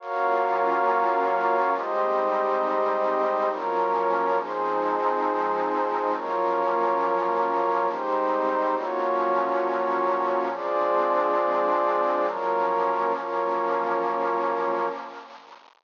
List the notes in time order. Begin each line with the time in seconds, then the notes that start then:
0.00 F#3 A#3 C#4 F4 F#4 A#4 C#5 F5
1.75 G#2 G3 G#3 C4 D#4 G4 C5 D#5
3.50 F#2 F3 F#3 A#3 C#4 F4 A#4 C#5
4.38 F3 G#3 C4 D#4 G#4 C5
6.13 F#2 F3 F#3 A#3 C#4 F4 A#4 C#5
7.88 G#2 G3 G#3 C4 D#4 G4 C5
8.75 A#2 F3 F#3 A#3 C#4 F4 F#4 C#5
10.51 F3 G#3 C4 D4 F4 G#4 C5 D5
12.26 F#2 F3 F#3 A#3 C#4 F4 A#4 C#5
13.14 F#2 F3 F#3 A#3 C#4 F4 A#4 C#5